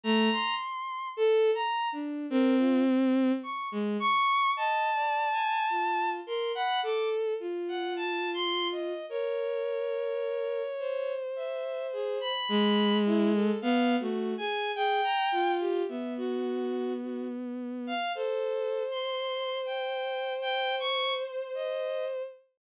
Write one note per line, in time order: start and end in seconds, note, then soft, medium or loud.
0.04 0.29 A3 loud
0.04 0.54 A#5 loud
0.32 1.08 C6 medium
1.17 1.51 A4 loud
1.55 1.89 A#5 medium
1.92 2.26 D4 medium
2.30 3.32 C4 loud
2.30 2.56 A#4 medium
2.58 2.83 F4 medium
3.43 3.69 C#6 medium
3.72 3.97 G#3 medium
4.00 4.51 C#6 loud
4.56 4.90 D#5 medium
4.56 6.10 A5 medium
4.94 5.28 D5 medium
5.32 5.66 G#5 medium
5.70 6.21 F4 medium
6.27 6.52 A#4 medium
6.27 6.52 C6 medium
6.55 6.80 F#5 medium
6.55 6.80 B5 medium
6.83 7.34 A4 medium
6.83 7.09 D6 medium
7.40 8.93 F4 medium
7.68 7.94 F#5 medium
7.96 8.30 A5 medium
8.34 8.68 C6 loud
8.72 9.06 D#5 medium
9.09 10.62 A#4 medium
9.09 11.13 C#5 medium
10.79 12.32 C5 medium
11.36 11.87 E5 medium
11.93 12.18 G#4 medium
12.21 12.97 B5 loud
12.49 13.51 G#3 loud
13.06 13.31 E4 loud
13.33 13.59 A4 medium
13.62 13.96 B3 loud
13.62 13.96 F5 loud
14.00 14.34 A3 medium
14.00 14.34 F#4 medium
14.37 14.72 G#4 medium
14.37 14.71 G#5 loud
14.75 15.01 G#4 loud
14.75 15.52 G5 medium
15.04 15.29 A#5 medium
15.32 15.83 F4 loud
15.60 15.86 G4 medium
15.88 17.92 B3 medium
15.88 16.14 E5 medium
16.17 16.94 F#4 loud
17.02 17.28 F#4 medium
17.87 18.12 F5 loud
18.15 18.83 A4 loud
18.15 22.23 C5 medium
18.91 19.58 C6 medium
19.66 20.33 G5 medium
20.42 20.75 G5 loud
20.80 21.14 C#6 loud
21.17 21.51 C5 medium
21.54 22.05 D#5 medium